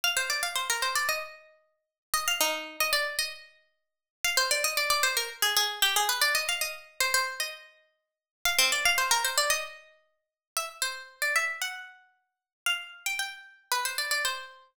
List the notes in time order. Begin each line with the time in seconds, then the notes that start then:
0.04 F5
0.17 C5
0.30 D5
0.43 F5
0.55 C5
0.70 A#4
0.82 C5
0.96 D5
1.09 D#5
2.14 D#5
2.28 F5
2.41 D#4
2.80 D#5
2.93 D5
3.19 D#5
4.24 F5
4.37 C5
4.51 D5
4.64 D#5
4.77 D5
4.90 D5
5.03 C5
5.17 A#4
5.42 G#4
5.57 G#4
5.82 G4
5.96 G#4
6.09 B4
6.21 D5
6.35 D#5
6.49 F5
6.61 D#5
7.00 C5
7.14 C5
7.40 D#5
8.45 F5
8.59 C4
8.72 D5
8.85 F5
8.98 C5
9.11 A#4
9.25 C5
9.38 D5
9.50 D#5
10.57 E5
10.82 C5
11.22 D5
11.36 E5
11.62 F#5
12.66 F5
13.06 G5
13.19 G5
13.72 B4
13.85 C5
13.98 D5
14.11 D5
14.25 C5